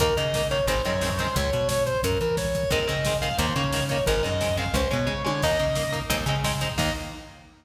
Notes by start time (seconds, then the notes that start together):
0.00 D#2 D#3 A#3 A#4, kick, closed hi-hat
0.09 kick
0.17 C#3 D#3 A#3 D#5, kick, closed hi-hat
0.25 kick
0.34 D#3 A#3, kick, snare
0.42 kick
0.51 D#3 A#3 C#5, kick, closed hi-hat
0.59 kick
0.67 G#1 D#3 G#3 C4 C5, kick, closed hi-hat
0.77 kick
0.85 F#2 D#3 G#3 C4 C#5, kick, closed hi-hat
0.94 kick
1.01 D#3 G#3 C4, kick, snare
1.10 kick
1.18 D#3 G#3 C4 C5, kick, snare, closed hi-hat
1.27 kick
1.36 C#2 C#5, kick, closed hi-hat
1.45 kick
1.53 B2, kick, closed hi-hat
1.61 kick
1.68 C#5, kick, snare
1.78 kick
1.86 C5, kick, closed hi-hat
1.95 kick
2.03 F#2 A#4, kick, closed hi-hat
2.12 kick
2.19 E3 A#4, kick, closed hi-hat
2.29 kick
2.37 C#5, kick, snare
2.45 kick
2.54 kick, snare, closed hi-hat
2.63 kick
2.70 D#2 D#3 G#3 C4 A#4, kick, closed hi-hat
2.80 kick
2.87 C#3 D#3 G#3 C4 D#5, kick, closed hi-hat
2.97 kick
3.05 D#3 G#3 C4, kick, snare
3.14 kick
3.22 D#3 G#3 C4 F5, kick, closed hi-hat
3.31 kick
3.38 D#2 D#3 A#3 C5, kick, closed hi-hat
3.48 kick
3.56 C#3 D#3 A#3 C#5, kick, closed hi-hat
3.64 kick
3.73 D#3 A#3, kick, snare
3.81 kick
3.89 D#3 A#3 C#5, kick, snare, closed hi-hat
3.99 kick
4.06 G#1 D#3 G#3 C4 A#4, kick, closed hi-hat
4.15 kick
4.23 F#2 D#3 G#3 C4 D#5, kick, closed hi-hat
4.32 kick
4.41 D#3 G#3 C4, kick, snare
4.49 kick
4.57 D#3 G#3 C4 F5, kick, closed hi-hat
4.66 kick
4.74 C#2 G#3 C#4 C5, kick, closed hi-hat
4.82 kick
4.90 B2 G#3 C#4 C#5, kick, closed hi-hat
4.99 kick
5.07 C#3 G#3 C#4, kick
5.25 D3 G#3 C#4 C#5, high tom
5.42 D#2 A#3 D#4 D#5, kick, crash
5.51 kick
5.59 C#3 A#3 D#4, kick, closed hi-hat
5.68 kick
5.75 A#3 D#4, kick, snare
5.84 kick
5.92 A#3 D#4, kick, closed hi-hat
6.02 kick
6.10 D#2 G#3 C4 D#4, kick, closed hi-hat
6.19 kick
6.26 C#3 G#3 C4 D#4, kick, closed hi-hat
6.36 kick
6.44 G#3 C4 D#4, kick, snare
6.53 kick
6.60 G#3 C4 D#4, kick, snare, closed hi-hat
6.70 kick
6.78 D#2 D#3 A#3 D#5, kick, crash